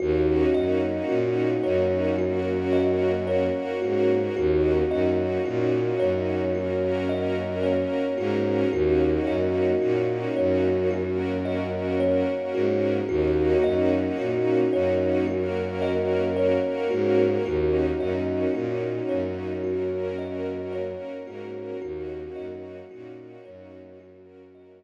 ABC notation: X:1
M:4/4
L:1/8
Q:1/4=55
K:Ebdor
V:1 name="Kalimba"
G e G d G e d G | G e G d G e d G | G e G d G e d G | G e G d G e d G |
G e G d G e d G | G e G d G e z2 |]
V:2 name="Violin" clef=bass
E,, G,, B,, G,,4 A,, | E,, G,, B,, G,,4 A,, | E,, G,, B,, G,,4 A,, | E,, G,, B,, G,,4 A,, |
E,, G,, B,, G,,4 A,, | E,, G,, B,, G,,4 z |]
V:3 name="String Ensemble 1"
[B,DEG]4 [B,DGB]4 | [B,DEG]4 [B,DGB]4 | [B,DEG]4 [B,DGB]4 | [B,DEG]4 [B,DGB]4 |
[B,DEG]4 [B,DGB]4 | [B,DEG]4 [B,DGB]4 |]